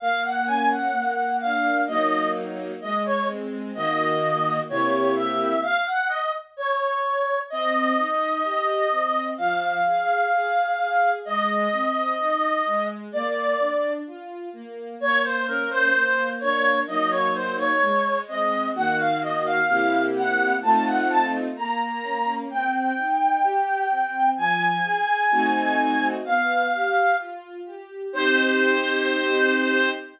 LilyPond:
<<
  \new Staff \with { instrumentName = "Clarinet" } { \time 2/4 \key bes \minor \tempo 4 = 64 f''16 ges''16 aes''16 ges''8. f''8 | ees''8 r8 ees''16 des''16 r8 | ees''4 des''8 e''8 | f''16 ges''16 ees''16 r16 des''4 |
\key c \minor ees''2 | f''2 | ees''2 | d''4 r4 |
\key bes \minor des''16 c''16 bes'16 c''8. des''8 | ees''16 des''16 c''16 des''8. ees''8 | ges''16 f''16 ees''16 f''8. ges''8 | a''16 ges''16 a''16 r16 bes''4 |
\key c \minor g''2 | aes''2 | f''4 r4 | c''2 | }
  \new Staff \with { instrumentName = "String Ensemble 1" } { \time 2/4 \key bes \minor bes8 des'8 bes8 d'8 | <ges bes ees'>4 aes8 c'8 | <ees bes ges'>4 <c bes e' g'>4 | r2 |
\key c \minor c'8 ees'8 g'8 c'8 | f8 aes'8 aes'8 aes'8 | aes8 c'8 ees'8 aes8 | bes8 d'8 f'8 bes8 |
\key bes \minor bes8 des'8 bes8 d'8 | <ges bes ees'>4 aes8 c'8 | <ees bes ges'>4 <c bes e' g'>4 | <a c' ees' f'>4 bes8 des'8 |
\key c \minor c'8 ees'8 g'8 c'8 | f8 aes'8 <a c' ees' fis'>4 | b8 g'8 f'8 g'8 | <c' ees' g'>2 | }
>>